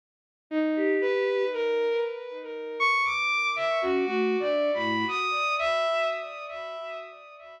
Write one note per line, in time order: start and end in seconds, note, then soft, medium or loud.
0.50 0.96 D#4 medium
0.76 1.45 G4 medium
1.01 1.47 B4 loud
1.53 1.99 A#4 loud
2.79 3.02 C#6 loud
3.04 3.50 D6 loud
3.56 3.79 E5 medium
3.82 4.05 C#4 medium
3.82 4.05 F#4 medium
4.06 4.36 A3 medium
4.06 4.36 F#4 loud
4.40 4.71 D4 medium
4.40 4.70 D5 medium
4.74 5.05 A2 medium
4.74 5.05 B5 medium
5.08 5.54 D#6 medium
5.59 6.05 E5 loud